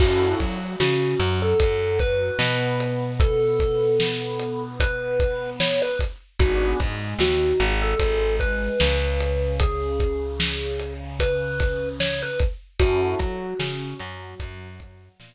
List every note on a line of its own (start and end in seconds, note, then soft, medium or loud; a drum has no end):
0.00 0.35 F#2 medium
0.00 0.37 C#4 medium
0.00 0.37 E4 medium
0.00 0.34 F#4 loud
0.00 0.37 F#4 medium
0.00 0.37 A4 medium
0.00 kick loud
0.00 crash loud
0.39 0.76 F#3 medium
0.39 0.73 F#4 medium
0.39 kick medium
0.39 closed hi-hat medium
0.80 1.15 C#3 medium
0.80 1.16 C#4 medium
0.80 1.40 F#4 medium
0.80 snare loud
1.20 1.54 F#2 medium
1.20 1.55 F#3 medium
1.20 closed hi-hat medium
1.42 1.99 A4 medium
1.59 2.31 F#2 medium
1.59 2.28 F#3 medium
1.59 kick medium
1.59 closed hi-hat loud
1.99 3.12 B4 loud
1.99 kick medium
1.99 closed hi-hat medium
2.39 5.81 B2 medium
2.39 5.82 B3 medium
2.39 snare medium
2.80 closed hi-hat medium
3.20 4.62 A4 loud
3.20 kick loud
3.20 closed hi-hat medium
3.60 kick medium
3.60 closed hi-hat medium
4.00 snare loud
4.40 closed hi-hat medium
4.80 5.50 B4 loud
4.80 kick medium
4.80 closed hi-hat loud
5.20 kick medium
5.20 closed hi-hat medium
5.60 5.81 C#5 medium
5.60 snare loud
5.82 5.99 B4 loud
5.99 kick medium
5.99 closed hi-hat medium
6.40 6.74 G#1 medium
6.40 6.77 B3 medium
6.40 6.77 D4 medium
6.40 6.78 F#4 loud
6.40 6.77 F#4 medium
6.40 6.77 G#4 medium
6.40 kick loud
6.40 closed hi-hat medium
6.80 7.15 G#2 medium
6.80 7.15 G#3 medium
6.80 kick medium
6.80 closed hi-hat medium
7.19 7.53 D#2 medium
7.19 7.55 D#3 medium
7.19 7.72 F#4 medium
7.19 snare loud
7.59 7.95 G#1 medium
7.59 7.93 G#3 medium
7.59 closed hi-hat medium
7.82 8.36 A4 loud
8.00 8.69 G#1 medium
8.00 8.70 G#3 medium
8.00 kick medium
8.00 closed hi-hat loud
8.40 9.56 B4 medium
8.40 kick medium
8.40 closed hi-hat medium
8.79 12.23 C#2 medium
8.79 12.21 C#3 medium
8.79 snare loud
9.21 closed hi-hat medium
9.60 10.93 G#4 loud
9.60 kick medium
9.60 closed hi-hat loud
10.00 kick medium
10.00 closed hi-hat medium
10.40 snare loud
10.79 closed hi-hat medium
11.20 11.89 B4 medium
11.20 kick medium
11.20 closed hi-hat loud
11.60 kick medium
11.60 snare soft
11.60 closed hi-hat medium
12.00 12.21 C#5 loud
12.00 snare loud
12.22 12.39 B4 loud
12.40 kick medium
12.40 closed hi-hat medium
12.80 13.15 F#2 medium
12.80 13.17 C#4 medium
12.80 13.17 E4 medium
12.80 14.68 F#4 loud
12.80 13.17 F#4 medium
12.80 13.17 A4 medium
12.80 kick medium
12.80 closed hi-hat loud
13.19 13.54 F#3 medium
13.19 13.55 F#4 medium
13.19 kick medium
13.19 closed hi-hat medium
13.60 13.94 C#3 medium
13.60 13.95 C#4 medium
13.60 snare loud
14.00 14.35 F#2 medium
14.00 14.34 F#3 medium
14.00 closed hi-hat medium
14.39 15.09 F#2 medium
14.39 15.08 F#3 medium
14.39 kick medium
14.39 closed hi-hat medium
14.80 kick medium
14.80 closed hi-hat medium
15.20 15.35 A#2 medium
15.20 15.35 B3 medium
15.20 snare loud